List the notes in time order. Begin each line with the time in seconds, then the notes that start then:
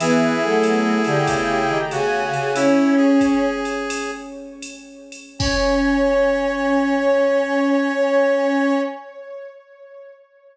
0.00 E3 B3 E4 G#4 B4, ride
0.41 F#3 A3 A4
0.63 hi-hat pedal, ride
1.04 D3 G4 G5, ride
1.26 C#3, kick, ride
1.68 D#3
1.90 C#3 F#4 G#4 G#5, hi-hat pedal, ride
2.32 C#3, ride
2.54 C#4 E4 C#5, ride
2.97 G#4
3.21 kick, hi-hat pedal, ride
3.65 ride
3.90 ride
4.62 hi-hat pedal, ride
5.12 ride
5.39 C#4 C#5, kick, crash